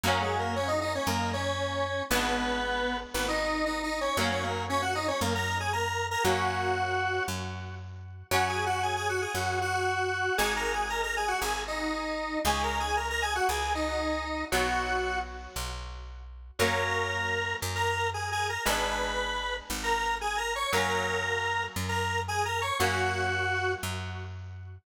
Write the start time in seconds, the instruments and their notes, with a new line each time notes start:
0.03 electric bass (finger) F#2, overdriven guitar F#3 A#3, lead 1 (square) A#3 A#4
0.08 overdriven guitar C#4
0.22 lead 1 (square) G#3 G#4
0.39 lead 1 (square) A#3 A#4
0.56 lead 1 (square) C#4 C#5
0.68 lead 1 (square) D#4 D#5
0.81 lead 1 (square) D#4 D#5
0.95 lead 1 (square) C#4 C#5
1.07 electric bass (finger) F#2, lead 1 (square) A#3 A#4
1.33 lead 1 (square) C#4 C#5
2.10 electric bass (finger) G#1, overdriven guitar G#3 B3, lead 1 (square) B3 B4
2.15 overdriven guitar D4
3.14 electric bass (finger) G#1, lead 1 (square) B3 B4
3.28 lead 1 (square) D#4 D#5
3.66 lead 1 (square) D#4 D#5
3.83 lead 1 (square) D#4 D#5
4.01 lead 1 (square) C#4 C#5
4.17 electric bass (finger) F#2, overdriven guitar F#3 A#3 C#4, lead 1 (square) A#3 A#4
4.31 lead 1 (square) C#4 C#5
4.43 lead 1 (square) A#3 A#4
4.69 lead 1 (square) C#4 C#5
4.82 lead 1 (square) F#4 F#5
4.95 lead 1 (square) D#4 D#5
5.08 lead 1 (square) C#4 C#5
5.21 electric bass (finger) F#2, lead 1 (square) A#3 A#4
5.35 lead 1 (square) A#4 A#5
5.60 lead 1 (square) G#4 G#5
5.73 lead 1 (square) A#4 A#5
6.11 lead 1 (square) A#4 A#5
6.24 electric bass (finger) F#2, overdriven guitar F#3 A#3, lead 1 (square) F#4 F#5
6.29 overdriven guitar C#4
7.28 electric bass (finger) F#2
8.31 electric bass (finger) F#2, overdriven guitar F#3 C#4, lead 1 (square) F#4 F#5
8.48 lead 1 (square) G#4 G#5
8.66 lead 1 (square) F#4 F#5
8.83 lead 1 (square) G#4 G#5
8.96 lead 1 (square) G#4 G#5
9.09 lead 1 (square) F#4 F#5
9.21 lead 1 (square) G#4 G#5
9.34 electric bass (finger) F#2, lead 1 (square) F#4 F#5
9.61 lead 1 (square) F#4 F#5
10.37 electric bass (finger) G#1, overdriven guitar G#3 D#4, lead 1 (square) G#4 G#5
10.56 lead 1 (square) A#4 A#5
10.73 lead 1 (square) G#4 G#5
10.89 lead 1 (square) A#4 A#5
11.03 lead 1 (square) A#4 A#5
11.16 lead 1 (square) G#4 G#5
11.28 lead 1 (square) F#4 F#5
11.41 electric bass (finger) G#1, lead 1 (square) G#4 G#5
11.67 lead 1 (square) D#4 D#5
12.45 electric bass (finger) C#2, overdriven guitar G#3 C#4, lead 1 (square) G#4 G#5
12.63 lead 1 (square) A#4 A#5
12.80 lead 1 (square) G#4 G#5
12.96 lead 1 (square) A#4 A#5
13.10 lead 1 (square) A#4 A#5
13.22 lead 1 (square) G#4 G#5
13.35 lead 1 (square) F#4 F#5
13.49 electric bass (finger) C#2, lead 1 (square) G#4 G#5
13.75 lead 1 (square) D#4 D#5
14.52 electric bass (finger) B1, overdriven guitar F#3 B3, lead 1 (square) F#4 F#5
15.56 electric bass (finger) B1
16.59 electric bass (finger) F#2, overdriven guitar F#3 A#3, lead 1 (square) A#4 A#5
16.63 overdriven guitar C#4
17.62 electric bass (finger) F#2
17.75 lead 1 (square) A#4 A#5
18.14 lead 1 (square) G#4 G#5
18.32 lead 1 (square) G#4 G#5
18.49 lead 1 (square) A#4 A#5
18.65 electric bass (finger) G#1, overdriven guitar G#3 B3, lead 1 (square) B4 B5
18.69 overdriven guitar D4
19.70 electric bass (finger) G#1
19.83 lead 1 (square) A#4 A#5
20.21 lead 1 (square) G#4 G#5
20.37 lead 1 (square) A#4 A#5
20.55 lead 1 (square) C#5 C#6
20.73 electric bass (finger) F#2, overdriven guitar F#3 A#3 C#4, lead 1 (square) A#4 A#5
21.76 electric bass (finger) F#2
21.88 lead 1 (square) A#4 A#5
22.28 lead 1 (square) G#4 G#5
22.45 lead 1 (square) A#4 A#5
22.61 lead 1 (square) C#5 C#6
22.80 electric bass (finger) F#2, overdriven guitar F#3 A#3 C#4, lead 1 (square) F#4 F#5
23.83 electric bass (finger) F#2